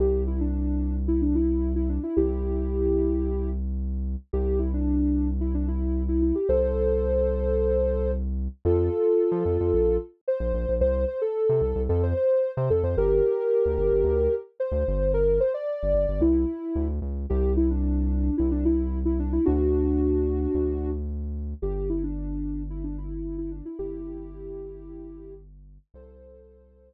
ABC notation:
X:1
M:4/4
L:1/16
Q:1/4=111
K:C
V:1 name="Ocarina"
G2 E D5 E D E3 E D E | [EG]12 z4 | G2 E D5 E D E3 E E G | [Ac]14 z2 |
[K:F] [FA]12 c4 | c2 c A5 A c c3 c A c | [GB]12 c4 | B2 c d5 E6 z2 |
[K:C] G2 E D5 E D E3 E D E | [D^F]12 z4 | G2 E D5 E D E3 E D E | [EG]12 z4 |
[Ac]10 z6 |]
V:2 name="Synth Bass 1" clef=bass
C,,16 | C,,16 | C,,16 | C,,16 |
[K:F] F,,5 F, F,, F,, B,,,5 B,,, B,,, B,,, | C,,5 C, C,, C,, F,,5 C, F,, F,, | G,,,5 D,, G,,, G,,, D,,5 D,, G,,,2- | G,,,5 G,,, G,,, G,,, C,,4 D,,2 _D,,2 |
[K:C] C,,8 C,,8 | D,,8 D,,8 | G,,,16 | G,,,16 |
C,,8 z8 |]